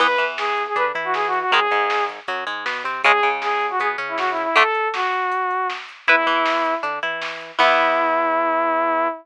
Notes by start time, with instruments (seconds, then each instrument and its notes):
0.00 synth bass 1 E2, acoustic guitar (steel) E3 B3, lead 2 (sawtooth) B4, kick, crash
0.18 synth bass 1 E2, acoustic guitar (steel) E3, closed hi-hat
0.38 lead 2 (sawtooth) G#4, snare
0.57 kick, closed hi-hat
0.67 lead 2 (sawtooth) G#4
0.76 synth bass 1 D3, acoustic guitar (steel) D4, lead 2 (sawtooth) B4, kick, closed hi-hat
0.94 synth bass 1 E3, acoustic guitar (steel) E4, closed hi-hat
1.04 lead 2 (sawtooth) F#4
1.14 lead 2 (sawtooth) G#4, snare
1.27 lead 2 (sawtooth) F#4
1.33 closed hi-hat
1.39 lead 2 (sawtooth) F#4
1.51 synth bass 1 G#1, acoustic guitar (steel) D#3 G#3, lead 2 (sawtooth) G#4, kick, closed hi-hat
1.70 synth bass 1 G#1, acoustic guitar (steel) G#2, closed hi-hat
1.90 snare
2.09 kick, closed hi-hat
2.28 synth bass 1 F#2, acoustic guitar (steel) F#3, kick, closed hi-hat
2.47 synth bass 1 G#2, acoustic guitar (steel) G#3, kick, closed hi-hat
2.66 synth bass 1 B2, acoustic guitar (steel) B3, snare
2.84 synth bass 1 C3, acoustic guitar (steel) C4, closed hi-hat
3.04 synth bass 1 C#2, acoustic guitar (steel) C#3 G#3, lead 2 (sawtooth) G#4, kick, closed hi-hat
3.23 synth bass 1 C#2, acoustic guitar (steel) C#3, closed hi-hat
3.42 lead 2 (sawtooth) G#4, snare
3.61 kick, closed hi-hat
3.70 lead 2 (sawtooth) F#4
3.79 synth bass 1 B2, acoustic guitar (steel) B3, lead 2 (sawtooth) G#4, kick, closed hi-hat
3.98 synth bass 1 C#3, acoustic guitar (steel) C#4, closed hi-hat
4.08 lead 2 (sawtooth) E4
4.18 lead 2 (sawtooth) F#4, snare
4.30 lead 2 (sawtooth) E4
4.37 closed hi-hat
4.43 lead 2 (sawtooth) E4
4.56 acoustic guitar (steel) D3 A3, lead 2 (sawtooth) A4, kick, closed hi-hat
4.75 closed hi-hat
4.94 lead 2 (sawtooth) F#4, snare
5.13 kick, closed hi-hat
5.32 kick, closed hi-hat
5.51 kick, closed hi-hat
5.70 snare
5.89 closed hi-hat
6.07 synth bass 1 E2, lead 2 (sawtooth) E4, acoustic guitar (steel) E4 B4, kick, closed hi-hat
6.26 synth bass 1 E2, acoustic guitar (steel) E3, closed hi-hat
6.46 snare
6.65 kick, closed hi-hat
6.83 synth bass 1 D3, acoustic guitar (steel) D4, kick, closed hi-hat
7.03 synth bass 1 E3, acoustic guitar (steel) E4, closed hi-hat
7.22 snare
7.41 closed hi-hat
7.59 synth bass 1 E2, acoustic guitar (steel) E3 B3, lead 2 (sawtooth) E4, kick, crash